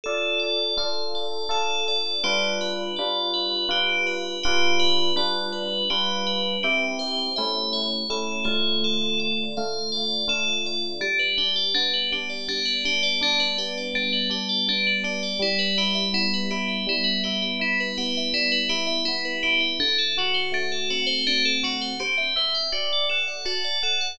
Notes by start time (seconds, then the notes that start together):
0.04 D4 F4 A4
0.39 D5
0.77 D4 F4 A4 F5
1.15 D5
1.49 D4 F4 A4
1.88 D5
2.23 G3 D4 F4 G4 B4
2.61 B4
2.96 G3 D4 F4 B4 D5
3.33 B4
3.69 G3 D4 F4 G4 B4
4.07 B4
4.43 G3 D4 F4 G4 B4
4.79 B4
5.16 G3 D4 F4 B4 D5
5.52 B4
5.90 G3 D4 F4 G4 B4
6.27 B4
6.63 C4 E4 G4
6.99 C5
7.36 A3 C#4 E4 E5
7.73 C#5
8.10 A3 C#4 E4 A4
8.44 D3 A3 F4 C#5
8.84 A4
9.19 D5
9.57 D3 A3 F4 F5
9.92 D5
10.28 D3 A3 F4 A4
10.66 D5
11.00 G3 D4
11.19 B4
11.37 D4 G4
11.55 D5
11.74 B3 D4
11.93 B4
12.12 D4 G4
12.29 D5
12.48 G3 D4
12.65 B4
12.85 D4 G4
13.03 D5
13.21 D4
13.39 B4
13.57 B3 G4
13.77 D5
13.94 G3 D4
14.12 B4
14.30 D4 G4
14.49 D5
14.68 B3 D4
14.87 B4
15.04 D4 G4
15.23 D5
15.39 G3 E4
15.58 B4
15.77 E4 G4
15.95 E5
16.13 B3 E4
16.33 B4
16.50 E4 G4
16.68 E5
16.87 G3 E4
17.04 B4
17.23 E4 G4
17.42 E5
17.59 E4
17.80 B4
17.97 B3 G4
18.17 E5
18.33 G3 E4
18.52 B4
18.69 E4 G4
18.87 E5
19.05 B3 E4
19.25 B4
19.43 E4 G4
19.60 E5
19.79 D3 D4
19.98 A4
20.17 F#4
20.34 C5
20.52 A3 D4
20.72 A4
20.90 C4 F#4
21.06 C5
21.27 D3 D4
21.45 A4
21.63 F#4
21.81 C5
21.99 G4 C5
22.17 E5
22.36 C5 E5
22.54 G5
22.72 F#4 D5
22.92 D5
23.09 A4 F#5
23.27 F#5
23.45 F#4 A5
23.64 D5
23.83 A4 F#5
24.01 F#5